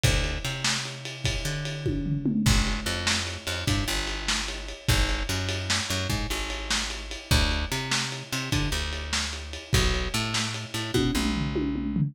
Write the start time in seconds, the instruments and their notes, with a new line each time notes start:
0.04 electric bass (finger) D2, kick, ride
0.24 ride
0.45 electric bass (finger) C3, ride
0.64 snare
0.85 ride
1.05 ride
1.24 kick, ride
1.45 electric bass (finger) D3, ride
1.65 ride
1.86 kick, high tom
2.06 floor tom
2.26 mid tom
2.46 electric bass (finger) G1, kick, crash
2.67 ride
2.86 electric bass (finger) F2, ride
3.07 snare
3.27 ride
3.47 electric bass (finger) F2, ride
3.67 electric bass (finger) G2, kick, ride
3.88 electric bass (finger) G1, ride
4.07 ride
4.28 snare
4.48 ride
4.69 ride
4.88 electric bass (finger) G#1, kick, ride
5.09 ride
5.29 electric bass (finger) F#2, ride
5.49 ride
5.70 snare
5.90 electric bass (finger) F#2, ride
6.10 electric bass (finger) G#2, kick, ride
6.30 electric bass (finger) G#1, ride
6.50 ride
6.70 snare
6.90 ride
7.11 ride
7.31 electric bass (finger) D2, kick, ride
7.51 ride
7.72 electric bass (finger) C3, ride
7.91 snare
8.12 ride
8.32 electric bass (finger) C3, ride
8.52 electric bass (finger) D3, kick, ride
8.72 electric bass (finger) D2, ride
8.93 ride
9.13 snare
9.33 ride
9.53 ride
9.73 electric bass (finger) B1, kick, ride
9.94 ride
10.14 electric bass (finger) A2, ride
10.34 snare
10.54 ride
10.74 electric bass (finger) A2, ride
10.94 electric bass (finger) B2, kick, high tom
11.15 electric bass (finger) B1, mid tom
11.36 floor tom
11.56 high tom
11.76 mid tom
11.96 floor tom